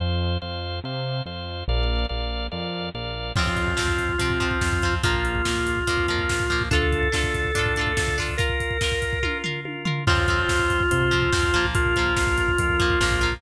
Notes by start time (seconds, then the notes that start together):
0.00 F2 C5 F5
0.42 F2 C5 F5
0.84 C3 C5 F5
1.26 F2 C5 F5
1.68 A#1 A#4 D5 F5
2.09 A#1 A#4 D5 F5
2.52 F2 A#4 D5 F5
2.94 A#1 A#4 D5 F5
3.36 F2 F3 C4 F4, kick, crash
3.47 kick
3.57 kick, closed hi-hat
3.67 kick
3.77 F2 F3 C4, kick, snare
3.88 kick
3.99 kick, closed hi-hat
4.09 kick
4.18 C3 F3 C4 F4, kick, closed hi-hat
4.30 kick
4.40 F3 C4, kick, closed hi-hat
4.51 kick
4.61 F2, kick, snare
4.72 kick
4.82 F3 C4, kick, closed hi-hat
4.93 kick
5.03 A#1 F3 A#3 F4, kick, closed hi-hat
5.14 kick
5.25 closed hi-hat
5.35 kick
5.45 A#1 F3 A#3, kick, snare
5.56 kick
5.66 kick, closed hi-hat
5.77 kick
5.87 F2 F3 A#3 F4, kick, closed hi-hat
5.98 kick
6.08 F3 A#3, kick, closed hi-hat
6.19 kick
6.29 A#1, kick, snare
6.40 kick
6.50 F3 A#3, kick, closed hi-hat
6.61 kick
6.71 D2 D4 F4 A4, kick, closed hi-hat
6.75 A4
6.82 kick
6.92 kick, closed hi-hat
7.03 kick
7.12 D2 D4 F4 A4, kick, snare
7.24 kick
7.34 kick, closed hi-hat
7.44 kick
7.54 A2 D4 F4 A4, kick, closed hi-hat
7.59 A4
7.66 kick
7.76 D4 F4, kick, closed hi-hat
7.81 A4
7.87 kick
7.97 D2 D4 F4 A4, kick, snare
8.08 kick
8.18 D4 F4 A4, kick, open hi-hat
8.28 kick
8.37 F4 A#4, kick, closed hi-hat
8.49 kick
8.60 kick, closed hi-hat
8.71 kick
8.81 F4 A#4, kick, snare
8.92 kick
9.02 kick, closed hi-hat
9.13 kick
9.23 F4 A#4, kick, high tom
9.44 F4 A#4, floor tom
9.65 F4 A#4, high tom
9.85 F4 A#4, floor tom
10.07 F2 F3 C4 F4 C5, kick, crash
10.18 kick
10.28 F3 C4, kick, closed hi-hat
10.39 kick
10.49 F2, kick, snare
10.59 kick
10.70 kick, closed hi-hat
10.80 kick
10.91 C3 F4 C5, kick, closed hi-hat
11.01 kick
11.11 F3 C4, kick, closed hi-hat
11.22 kick
11.32 F2 F3 C4, kick, snare
11.43 kick
11.53 A#1 F3 A#3, kick, closed hi-hat
11.64 kick
11.75 F4 A#4, kick, closed hi-hat
11.85 kick
11.96 F3 A#3, kick, closed hi-hat
12.06 kick
12.17 A#1, kick, snare
12.27 kick
12.38 kick, closed hi-hat
12.48 kick
12.58 F2 F4 A#4, kick, closed hi-hat
12.69 kick
12.80 F3 A#3, kick, closed hi-hat
12.90 kick
13.00 A#1 F3 A#3, kick, snare
13.11 kick
13.21 F3 A#3, kick, closed hi-hat
13.32 kick